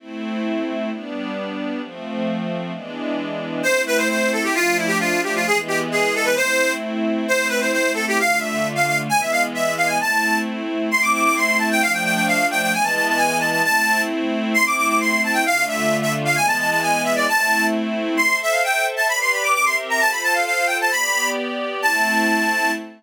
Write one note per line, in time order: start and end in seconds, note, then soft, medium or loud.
0.00 0.90 A3 medium
0.00 0.90 C4 medium
0.00 0.90 E4 medium
0.91 1.81 G3 medium
0.91 1.81 B3 medium
0.91 1.81 D4 medium
1.82 2.72 F3 medium
1.82 2.72 A3 medium
1.82 2.72 C4 medium
2.72 3.62 E3 medium
2.72 3.62 G#3 medium
2.72 3.62 B3 medium
2.72 3.62 D4 medium
3.63 4.54 A3 medium
3.63 4.54 C4 medium
3.63 4.54 E4 medium
3.63 3.82 C5 loud
3.87 3.98 B4 loud
3.97 4.08 C5 loud
4.09 4.31 C5 medium
4.32 4.43 A4 medium
4.43 4.54 G4 medium
4.54 5.44 F3 medium
4.54 5.44 A3 medium
4.54 5.44 D4 medium
4.54 4.77 F4 loud
4.77 4.88 E4 medium
4.87 4.98 G4 loud
5.00 5.21 F4 loud
5.23 5.34 G4 medium
5.35 5.46 F4 medium
5.45 6.35 E3 medium
5.45 6.35 G#3 medium
5.45 6.35 B3 medium
5.45 5.58 G#4 loud
5.68 5.79 G4 medium
5.92 6.14 G#4 medium
6.15 6.26 A4 loud
6.25 6.35 B4 loud
6.36 7.27 A3 medium
6.36 7.27 C4 medium
6.36 7.27 E4 medium
6.36 6.72 C5 loud
7.28 8.18 A3 medium
7.28 8.18 C4 medium
7.28 8.18 E4 medium
7.28 7.48 C5 loud
7.49 7.59 B4 medium
7.61 7.71 C5 medium
7.73 7.91 C5 medium
7.94 8.05 A4 medium
8.08 8.19 G4 loud
8.18 9.08 D3 medium
8.18 9.08 A3 medium
8.18 9.08 F4 medium
8.18 8.39 F5 loud
8.40 8.68 E5 medium
8.75 8.86 F5 medium
8.87 8.98 F5 medium
9.09 9.99 E3 medium
9.09 9.99 G#3 medium
9.09 9.99 B3 medium
9.09 9.20 G#5 loud
9.21 9.32 E5 medium
9.32 9.43 F5 loud
9.54 9.74 E5 medium
9.77 9.88 F5 medium
9.87 9.98 G#5 medium
9.99 10.89 A3 medium
9.99 10.89 C4 medium
9.99 10.89 E4 medium
9.99 10.38 A5 loud
10.91 11.80 A3 medium
10.91 11.80 C4 medium
10.91 11.80 E4 medium
10.91 11.02 C6 loud
11.02 11.12 D6 medium
11.13 11.24 D6 medium
11.25 11.35 D6 loud
11.36 11.57 C6 loud
11.58 11.69 A5 medium
11.71 11.82 G5 loud
11.81 12.72 F3 medium
11.81 12.72 A3 medium
11.81 12.72 D4 medium
11.81 11.92 F5 loud
11.93 12.04 G5 medium
12.04 12.15 G5 loud
12.15 12.26 G5 medium
12.27 12.46 F5 loud
12.51 12.61 G5 loud
12.62 12.73 G5 loud
12.72 13.62 E3 loud
12.72 13.62 G#3 medium
12.72 13.62 B3 medium
12.72 12.84 G#5 loud
12.84 12.95 A5 medium
12.95 13.06 A5 medium
13.08 13.19 A5 medium
13.17 13.38 G#5 loud
13.39 13.50 A5 medium
13.52 13.62 A5 loud
13.64 14.54 A3 medium
13.64 14.54 C4 medium
13.64 14.54 E4 medium
13.64 14.02 A5 loud
14.54 15.44 A3 medium
14.54 15.44 C4 medium
14.54 15.44 E4 medium
14.54 14.65 C6 loud
14.66 14.76 D6 medium
14.77 14.87 D6 loud
14.88 14.99 D6 medium
15.01 15.21 C6 loud
15.24 15.35 A5 medium
15.33 15.44 G5 loud
15.46 16.36 D3 medium
15.46 16.36 A3 medium
15.46 16.36 F4 medium
15.46 15.64 F5 loud
15.68 15.97 E5 medium
16.02 16.13 E5 loud
16.25 16.36 F5 loud
16.36 17.27 E3 medium
16.36 17.27 G#3 loud
16.36 17.27 B3 medium
16.36 16.46 G#5 loud
16.47 16.58 A5 loud
16.59 16.70 A5 medium
16.70 16.81 A5 loud
16.82 17.02 G#5 loud
17.04 17.15 E5 medium
17.16 17.27 D5 loud
17.28 18.18 A3 medium
17.28 18.18 C4 medium
17.28 18.18 E4 medium
17.28 17.66 A5 loud
18.17 19.09 A4 medium
18.17 19.09 C5 medium
18.17 19.09 E5 medium
18.17 18.37 C6 loud
18.42 18.53 E5 loud
18.51 18.62 F5 medium
18.64 18.86 G5 loud
18.96 19.07 A5 loud
19.08 19.54 G4 medium
19.08 19.54 B4 medium
19.08 19.54 D5 medium
19.08 19.19 B5 loud
19.21 19.32 C6 loud
19.32 19.43 B5 medium
19.43 19.54 D6 medium
19.54 20.00 C4 medium
19.54 20.00 G4 medium
19.54 20.00 A#4 medium
19.54 20.00 E5 medium
19.54 19.65 D6 loud
19.65 19.76 C6 loud
19.90 20.00 A#5 medium
20.00 20.90 F4 medium
20.00 20.90 A4 medium
20.00 20.90 C5 medium
20.00 20.11 A5 loud
20.11 20.22 B5 loud
20.23 20.34 A5 loud
20.33 20.44 F5 medium
20.46 20.67 F5 medium
20.67 20.77 G5 medium
20.81 20.92 A5 loud
20.91 21.81 B3 medium
20.91 21.81 G4 medium
20.91 21.81 D5 medium
20.91 21.29 B5 loud
21.82 22.71 A3 medium
21.82 22.71 C4 medium
21.82 22.71 E4 loud
21.82 22.71 A5 loud